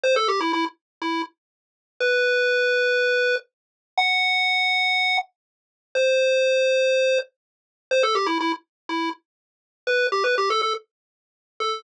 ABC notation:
X:1
M:4/4
L:1/16
Q:1/4=122
K:Em
V:1 name="Lead 1 (square)"
c A G E E z3 E2 z6 | B12 z4 | f12 z4 | c12 z4 |
c A G E E z3 E2 z6 | B2 G B G A A z7 A2 |]